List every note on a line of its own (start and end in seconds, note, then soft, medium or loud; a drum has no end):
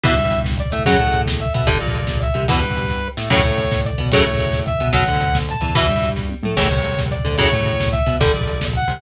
0.04 0.15 E2 medium
0.04 0.14 B2 loud
0.04 0.14 E3 loud
0.04 0.40 E5 loud
0.04 kick loud
0.04 closed hi-hat loud
0.12 0.62 G2 medium
0.12 kick medium
0.17 0.64 G3 medium
0.17 kick medium
0.17 closed hi-hat medium
0.25 kick medium
0.31 kick medium
0.31 closed hi-hat medium
0.38 kick medium
0.44 kick medium
0.44 snare medium
0.52 kick medium
0.57 0.71 D5 medium
0.57 kick medium
0.57 closed hi-hat medium
0.66 kick medium
0.72 0.85 A2 medium
0.72 0.84 A3 medium
0.72 0.83 E5 medium
0.72 kick medium
0.72 closed hi-hat medium
0.79 kick medium
0.85 0.99 F#2 medium
0.85 0.97 C#3 loud
0.85 0.97 F#3 loud
0.85 1.21 F#5 loud
0.85 kick medium
0.85 closed hi-hat medium
0.93 kick medium
0.98 1.46 A2 medium
0.98 1.46 A3 medium
0.98 kick medium
0.98 closed hi-hat medium
1.07 kick medium
1.12 kick medium
1.12 closed hi-hat medium
1.20 kick medium
1.26 kick medium
1.26 snare loud
1.32 kick medium
1.40 1.53 E5 medium
1.40 kick medium
1.40 closed hi-hat medium
1.46 kick medium
1.54 1.66 B2 medium
1.54 1.66 B3 medium
1.54 1.69 E5 medium
1.54 kick medium
1.54 closed hi-hat medium
1.59 kick medium
1.66 1.79 G1 medium
1.66 1.78 D3 loud
1.66 1.78 G3 loud
1.66 2.19 D5 loud
1.66 kick medium
1.66 closed hi-hat loud
1.75 kick medium
1.80 2.28 A#1 medium
1.80 2.27 A#2 medium
1.80 kick medium
1.80 closed hi-hat medium
1.87 kick medium
1.95 kick medium
1.95 closed hi-hat medium
2.02 kick medium
2.07 kick medium
2.07 snare loud
2.16 kick medium
2.21 2.44 E5 medium
2.21 kick medium
2.21 closed hi-hat medium
2.29 kick medium
2.34 2.47 C2 medium
2.34 2.46 C3 medium
2.34 kick medium
2.34 closed hi-hat medium
2.43 kick medium
2.48 2.61 E2 medium
2.48 2.60 B2 loud
2.48 2.60 E3 medium
2.48 3.08 B4 loud
2.48 kick loud
2.48 closed hi-hat loud
2.55 kick medium
2.62 3.09 G2 medium
2.62 3.08 G3 medium
2.62 kick medium
2.62 closed hi-hat medium
2.70 kick medium
2.77 kick medium
2.77 closed hi-hat medium
2.83 kick medium
2.88 kick medium
2.88 snare medium
3.17 3.29 A2 medium
3.17 3.29 A3 medium
3.17 snare loud
3.30 3.42 F#2 medium
3.30 3.41 A2 loud
3.30 3.41 C#3 loud
3.30 3.41 F#3 loud
3.30 3.81 C#5 loud
3.30 kick medium
3.30 crash medium
3.38 kick medium
3.43 3.91 A2 medium
3.43 3.90 A3 medium
3.43 kick medium
3.43 closed hi-hat medium
3.51 kick medium
3.57 kick medium
3.57 closed hi-hat medium
3.64 kick medium
3.71 kick medium
3.71 snare medium
3.79 kick medium
3.85 4.08 D5 medium
3.85 kick medium
3.85 closed hi-hat medium
3.93 kick medium
3.98 4.11 B2 medium
3.98 4.10 B3 medium
3.98 kick medium
3.98 closed hi-hat medium
4.06 kick medium
4.12 4.24 F#2 medium
4.12 4.24 A2 loud
4.12 4.24 C#3 loud
4.12 4.24 F#3 loud
4.12 4.60 C#5 medium
4.12 kick medium
4.12 closed hi-hat loud
4.19 kick medium
4.25 4.72 A2 medium
4.25 4.72 A3 medium
4.25 kick medium
4.25 closed hi-hat medium
4.33 kick medium
4.38 kick medium
4.38 closed hi-hat medium
4.46 kick medium
4.52 kick medium
4.52 snare medium
4.59 kick medium
4.66 4.89 E5 medium
4.66 kick medium
4.66 closed hi-hat medium
4.74 kick medium
4.79 4.92 B2 medium
4.79 4.92 B3 medium
4.79 kick medium
4.79 closed hi-hat medium
4.87 kick medium
4.93 5.05 B1 medium
4.93 5.04 B2 loud
4.93 5.04 F#3 loud
4.93 5.38 F#5 medium
4.93 kick medium
4.93 closed hi-hat medium
5.01 kick medium
5.06 5.54 D2 medium
5.06 5.54 D3 medium
5.06 kick medium
5.06 closed hi-hat medium
5.16 kick medium
5.21 kick medium
5.21 closed hi-hat medium
5.27 kick medium
5.35 kick medium
5.35 snare loud
5.42 kick medium
5.49 5.76 A5 medium
5.49 kick medium
5.49 closed hi-hat medium
5.54 kick medium
5.61 5.74 E2 medium
5.61 5.73 E3 medium
5.61 kick medium
5.61 closed hi-hat medium
5.69 kick medium
5.75 5.87 E2 medium
5.75 5.86 B2 loud
5.75 5.86 E3 loud
5.75 6.10 E5 loud
5.75 kick medium
5.75 closed hi-hat medium
5.83 kick medium
5.88 6.34 G2 medium
5.88 6.37 G3 medium
5.88 kick medium
5.88 closed hi-hat medium
5.96 kick medium
6.01 kick medium
6.01 closed hi-hat medium
6.09 kick medium
6.16 kick medium
6.16 snare medium
6.29 high tom medium
6.43 6.55 A2 medium
6.43 6.57 A3 medium
6.43 mid tom medium
6.56 6.69 A1 medium
6.56 6.68 A2 loud
6.56 6.68 C#3 loud
6.56 6.68 E3 loud
6.56 7.01 C#5 medium
6.56 kick medium
6.56 crash medium
6.64 kick medium
6.71 7.17 C2 medium
6.71 7.17 C3 medium
6.71 kick medium
6.71 closed hi-hat medium
6.76 kick medium
6.84 kick medium
6.84 closed hi-hat medium
6.92 kick medium
6.98 kick medium
6.98 snare medium
7.06 kick medium
7.11 7.35 D5 medium
7.11 kick medium
7.11 closed hi-hat medium
7.19 kick medium
7.25 7.37 D2 medium
7.25 7.36 D3 medium
7.25 kick medium
7.25 closed hi-hat medium
7.31 kick medium
7.38 7.49 F#2 medium
7.38 7.49 A2 loud
7.38 7.49 C#3 loud
7.38 7.49 F#3 loud
7.38 7.89 C#5 loud
7.38 kick medium
7.38 closed hi-hat medium
7.45 kick medium
7.52 7.99 A2 medium
7.52 8.00 A3 medium
7.52 kick medium
7.52 closed hi-hat medium
7.61 kick medium
7.65 kick medium
7.65 closed hi-hat medium
7.73 kick medium
7.80 kick medium
7.80 snare loud
7.86 kick medium
7.92 8.16 E5 medium
7.92 kick medium
7.92 closed hi-hat medium
8.00 kick medium
8.06 8.18 B2 medium
8.06 8.18 B3 medium
8.06 kick medium
8.06 closed hi-hat medium
8.14 kick medium
8.20 8.32 G1 medium
8.20 8.32 D3 loud
8.20 8.32 G3 loud
8.20 8.64 D5 loud
8.20 kick loud
8.20 closed hi-hat medium
8.26 kick medium
8.34 8.80 A#1 medium
8.34 8.81 A#2 medium
8.34 kick medium
8.34 closed hi-hat medium
8.41 kick medium
8.47 kick medium
8.47 closed hi-hat medium
8.53 kick medium
8.61 kick medium
8.61 snare loud
8.68 kick medium
8.73 9.01 F#5 medium
8.73 kick medium
8.73 closed hi-hat medium
8.82 kick medium
8.88 8.99 C2 medium
8.88 8.99 C3 medium
8.88 kick medium
8.88 closed hi-hat medium
8.97 kick medium